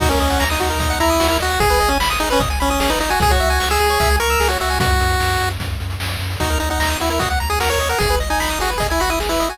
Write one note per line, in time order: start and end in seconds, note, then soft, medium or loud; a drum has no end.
0.00 0.16 D#2 medium
0.00 0.09 D#4 loud
0.00 0.09 F#4 loud
0.00 kick loud
0.00 crash loud
0.09 0.44 C#4 medium
0.09 0.19 A#4 medium
0.09 closed hi-hat medium
0.20 0.37 D#2 medium
0.20 0.29 D#5 medium
0.20 closed hi-hat medium
0.30 0.39 F#5 medium
0.30 closed hi-hat medium
0.40 0.58 D#2 medium
0.40 0.49 A#5 loud
0.40 snare loud
0.50 0.99 D#4 medium
0.50 0.59 D#6 medium
0.50 closed hi-hat medium
0.60 0.78 D#2 medium
0.60 0.69 F#4 medium
0.60 closed hi-hat medium
0.70 0.79 A#4 medium
0.70 closed hi-hat medium
0.79 0.96 D#2 medium
0.79 0.89 D#5 medium
0.79 kick medium
0.79 closed hi-hat medium
0.90 0.99 F#5 loud
0.90 closed hi-hat medium
1.00 1.18 D#2 medium
1.00 1.27 E4 loud
1.00 1.09 A#5 medium
1.00 closed hi-hat medium
1.10 1.19 D#6 medium
1.10 closed hi-hat medium
1.20 1.38 D#2 medium
1.20 1.29 F#4 loud
1.20 snare loud
1.28 1.38 E4 loud
1.28 1.39 A#4 medium
1.28 closed hi-hat medium
1.40 1.58 D#2 medium
1.40 1.60 F#4 loud
1.40 1.49 D#5 medium
1.40 closed hi-hat medium
1.50 1.59 F#5 medium
1.50 closed hi-hat medium
1.60 1.77 G#1 medium
1.60 1.69 G#4 loud
1.60 1.90 G#4 loud
1.60 kick medium
1.60 closed hi-hat medium
1.70 1.79 B4 medium
1.70 closed hi-hat medium
1.80 1.98 G#1 medium
1.80 1.89 D#5 medium
1.80 closed hi-hat medium
1.89 1.98 C#4 medium
1.89 1.99 G#5 medium
1.89 closed hi-hat medium
2.00 2.17 G#1 medium
2.00 2.09 B5 medium
2.00 snare loud
2.10 2.19 D#6 medium
2.10 closed hi-hat medium
2.20 2.37 G#1 medium
2.20 2.29 D#4 loud
2.20 2.29 G#4 medium
2.30 2.42 C#4 loud
2.30 2.39 B4 medium
2.30 closed hi-hat medium
2.39 2.56 G#1 medium
2.39 2.49 D#5 medium
2.39 kick loud
2.39 closed hi-hat medium
2.50 2.59 G#5 medium
2.50 closed hi-hat medium
2.60 2.77 G#1 medium
2.60 2.70 C#4 loud
2.60 2.69 B5 medium
2.60 closed hi-hat medium
2.70 2.80 C#4 medium
2.70 2.79 D#6 medium
2.70 closed hi-hat medium
2.80 2.97 G#1 medium
2.80 2.90 C#4 loud
2.80 2.89 G#4 medium
2.80 snare loud
2.90 2.99 D#4 loud
2.90 2.99 B4 medium
2.90 closed hi-hat medium
2.99 3.16 G#1 medium
2.99 3.10 D#4 loud
2.99 3.09 D#5 medium
2.99 closed hi-hat medium
3.10 3.20 F#4 medium
3.10 3.19 G#5 medium
3.10 closed hi-hat medium
3.20 3.37 C#2 medium
3.20 3.29 G#4 loud
3.20 3.32 G#4 loud
3.20 kick loud
3.20 closed hi-hat medium
3.30 3.69 F#4 loud
3.30 3.39 C#5 medium
3.30 kick medium
3.30 closed hi-hat medium
3.40 3.59 C#2 medium
3.40 3.49 E5 medium
3.40 closed hi-hat medium
3.50 3.59 G#5 medium
3.50 closed hi-hat medium
3.60 3.78 C#2 medium
3.60 3.69 C#6 medium
3.60 snare loud
3.70 4.16 G#4 loud
3.70 3.79 E6 medium
3.70 closed hi-hat medium
3.80 3.98 C#2 medium
3.80 3.89 G#4 medium
3.80 closed hi-hat medium
3.90 3.99 C#5 medium
3.90 closed hi-hat medium
4.00 4.18 C#2 medium
4.00 4.09 E5 loud
4.00 kick medium
4.00 closed hi-hat medium
4.10 4.19 G#5 medium
4.10 closed hi-hat medium
4.19 4.36 C#2 medium
4.19 4.48 A#4 loud
4.19 4.29 C#6 medium
4.19 closed hi-hat medium
4.30 4.39 E6 medium
4.30 closed hi-hat medium
4.40 4.57 C#2 medium
4.40 4.49 G#4 medium
4.40 snare medium
4.48 4.58 F#4 loud
4.48 4.59 C#5 medium
4.48 closed hi-hat medium
4.60 4.79 C#2 medium
4.60 4.79 F#4 medium
4.60 4.69 E5 medium
4.60 closed hi-hat medium
4.70 4.79 G#5 medium
4.70 open hi-hat medium
4.79 4.97 F#2 medium
4.79 5.49 F#4 loud
4.79 kick loud
4.79 closed hi-hat loud
4.90 closed hi-hat medium
4.99 5.16 F#2 medium
4.99 closed hi-hat medium
5.10 closed hi-hat medium
5.20 5.37 F#2 medium
5.20 snare medium
5.30 closed hi-hat medium
5.40 5.58 F#2 medium
5.40 closed hi-hat medium
5.50 closed hi-hat medium
5.59 5.76 F#2 medium
5.59 kick medium
5.59 closed hi-hat medium
5.70 closed hi-hat medium
5.80 5.97 F#2 medium
5.80 closed hi-hat medium
5.90 closed hi-hat medium
6.00 6.17 F#2 medium
6.00 snare loud
6.10 closed hi-hat medium
6.19 6.36 F#2 medium
6.19 closed hi-hat medium
6.30 open hi-hat medium
6.40 6.58 D#2 medium
6.40 6.58 D#4 medium
6.40 6.49 F#4 loud
6.40 kick medium
6.40 closed hi-hat medium
6.50 6.59 A#4 medium
6.50 closed hi-hat medium
6.60 6.79 D#2 medium
6.60 6.69 D#4 medium
6.60 6.69 D#5 medium
6.60 closed hi-hat medium
6.70 6.98 D#4 medium
6.70 6.79 F#5 medium
6.70 closed hi-hat medium
6.79 6.96 D#2 medium
6.79 6.89 A#5 medium
6.79 snare loud
6.90 6.99 D#6 medium
6.90 closed hi-hat medium
7.00 7.19 D#2 medium
7.00 7.10 E4 medium
7.00 7.09 F#4 medium
7.00 closed hi-hat medium
7.10 7.20 E4 medium
7.10 7.19 A#4 medium
7.10 closed hi-hat medium
7.19 7.38 D#2 medium
7.19 7.29 F#4 medium
7.19 7.29 D#5 medium
7.19 kick medium
7.19 closed hi-hat loud
7.30 7.39 F#5 medium
7.30 closed hi-hat medium
7.40 7.59 D#2 medium
7.40 7.49 A#5 medium
7.40 closed hi-hat medium
7.50 7.59 G#4 medium
7.50 7.59 D#6 medium
7.50 closed hi-hat medium
7.60 7.77 D#2 medium
7.60 7.69 F#4 medium
7.60 7.70 A#4 medium
7.60 snare loud
7.70 7.79 A#4 medium
7.70 7.89 C#5 medium
7.70 closed hi-hat medium
7.78 7.95 D#2 medium
7.78 7.89 D#5 medium
7.78 closed hi-hat medium
7.89 7.99 A#4 medium
7.89 7.99 F#5 medium
7.89 closed hi-hat medium
7.99 8.18 G#1 medium
7.99 8.16 G#4 loud
7.99 8.09 G#4 loud
7.99 kick medium
7.99 closed hi-hat medium
8.10 8.19 B4 medium
8.10 closed hi-hat medium
8.20 8.38 G#1 medium
8.20 8.29 D#5 medium
8.20 closed hi-hat medium
8.30 8.59 D#4 medium
8.30 8.39 G#5 medium
8.30 closed hi-hat medium
8.40 8.57 G#1 medium
8.40 8.49 B5 medium
8.40 snare medium
8.50 8.59 D#6 medium
8.50 closed hi-hat medium
8.59 8.76 G#1 medium
8.59 8.71 F#4 loud
8.59 8.69 G#4 medium
8.59 closed hi-hat medium
8.70 8.79 B4 medium
8.70 closed hi-hat medium
8.78 8.95 G#1 medium
8.78 8.87 G#4 medium
8.78 8.89 D#5 medium
8.78 kick medium
8.78 closed hi-hat medium
8.90 9.01 E4 medium
8.90 8.99 G#5 medium
8.90 closed hi-hat medium
9.00 9.17 G#1 medium
9.00 9.10 F#4 loud
9.00 9.09 B5 medium
9.00 closed hi-hat medium
9.10 9.19 E4 medium
9.10 9.19 D#6 medium
9.10 closed hi-hat medium
9.20 9.37 G#1 medium
9.20 9.29 G#4 medium
9.20 snare medium
9.29 9.49 E4 medium
9.29 9.39 B4 medium
9.29 closed hi-hat medium
9.40 9.58 G#1 medium
9.40 9.49 D#5 medium
9.40 closed hi-hat medium
9.49 9.58 F#4 medium
9.49 9.58 G#5 medium
9.49 closed hi-hat medium